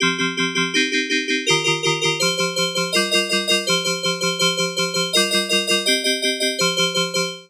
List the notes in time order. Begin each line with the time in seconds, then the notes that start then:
0.00 F3 C4 G4
0.18 F3 C4 G4
0.37 F3 C4 G4
0.55 F3 C4 G4
0.74 C4 D#4 G4
0.92 C4 D#4 G4
1.09 C4 D#4 G4
1.28 C4 D#4 G4
1.46 D#3 F4 G4 A#4
1.64 D#3 F4 G4 A#4
1.83 D#3 F4 G4 A#4
2.01 D#3 F4 G4 A#4
2.20 F3 G4 C5
2.37 F3 G4 C5
2.56 F3 G4 C5
2.75 F3 G4 C5
2.92 G3 F4 A#4 D#5
3.11 G3 F4 A#4 D#5
3.29 G3 F4 A#4 D#5
3.47 G3 F4 A#4 D#5
3.67 F3 G4 C5
3.84 F3 G4 C5
4.03 F3 G4 C5
4.21 F3 G4 C5
4.39 F3 G4 C5
4.57 F3 G4 C5
4.76 F3 G4 C5
4.94 F3 G4 C5
5.13 G3 F4 A#4 D#5
5.30 G3 F4 A#4 D#5
5.49 G3 F4 A#4 D#5
5.67 G3 F4 A#4 D#5
5.86 C4 G4 D#5
6.04 C4 G4 D#5
6.22 C4 G4 D#5
6.40 C4 G4 D#5
6.59 F3 G4 C5
6.77 F3 G4 C5
6.94 F3 G4 C5
7.14 F3 G4 C5